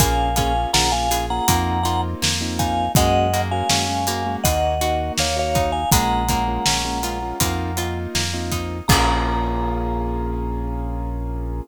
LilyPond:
<<
  \new Staff \with { instrumentName = "Vibraphone" } { \time 4/4 \key bes \minor \tempo 4 = 81 <f'' aes''>8 <f'' aes''>8 <ges'' bes''>16 <f'' aes''>8 <ges'' bes''>8. <ges'' bes''>16 r8. <f'' aes''>8 | <ees'' ges''>8. <f'' aes''>4~ <f'' aes''>16 <ees'' ges''>4 <des'' f''>16 <des'' f''>8 <f'' aes''>16 | <ges'' bes''>2. r4 | bes''1 | }
  \new Staff \with { instrumentName = "Acoustic Grand Piano" } { \time 4/4 \key bes \minor <bes des' f' aes'>8 <bes des' f' aes'>16 <bes des' f' aes'>16 <bes des' f' aes'>16 <bes des' f' aes'>16 <bes des' f' aes'>16 <bes des' f' aes'>16 <bes c' ees' f'>8 <bes c' ees' f'>8. <bes c' ees' f'>8. | <aes bes des' ges'>8 <aes bes des' ges'>16 <aes bes des' ges'>16 <aes bes des' ges'>16 <aes bes des' ges'>16 <aes bes des' ges'>16 <aes bes des' ges'>16 <bes ees' ges'>8 <bes ees' ges'>8. <bes ees' ges'>8. | <aes bes des' f'>8 <aes bes des' f'>16 <aes bes des' f'>16 <aes bes des' f'>16 <aes bes des' f'>16 <aes bes des' f'>16 <aes bes des' f'>16 <bes c' ees' f'>8 <bes c' ees' f'>8. <bes c' ees' f'>8. | <bes des' f' aes'>1 | }
  \new Staff \with { instrumentName = "Acoustic Guitar (steel)" } { \time 4/4 \key bes \minor bes8 des'8 f'8 aes'8 bes8 f'8 bes8 ees'8 | aes8 bes8 des'8 bes4 ges'8 bes8 ees'8 | aes8 bes8 des'8 f'8 bes8 f'8 bes8 ees'8 | <bes des' f' aes'>1 | }
  \new Staff \with { instrumentName = "Synth Bass 1" } { \clef bass \time 4/4 \key bes \minor bes,,4 bes,,4 f,4 f,4 | ges,4 ges,4 ees,4 ees,4 | bes,,4 bes,,4 f,4 f,4 | bes,,1 | }
  \new DrumStaff \with { instrumentName = "Drums" } \drummode { \time 4/4 <hh bd>8 <hh bd>8 sn8 hh8 <hh bd>8 hh8 sn8 <hh bd>8 | <hh bd>8 hh8 sn8 hh8 <hh bd>8 hh8 sn8 <hh bd>8 | <hh bd>8 <hh bd>8 sn8 hh8 <hh bd>8 hh8 sn8 <hh bd>8 | <cymc bd>4 r4 r4 r4 | }
>>